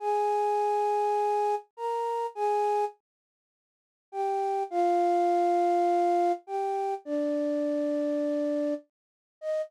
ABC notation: X:1
M:4/4
L:1/8
Q:1/4=102
K:Eb
V:1 name="Flute"
[Aa]6 [Bb]2 | [Aa]2 z4 [Gg]2 | [Ff]6 [Gg]2 | [Dd]6 z2 |
e2 z6 |]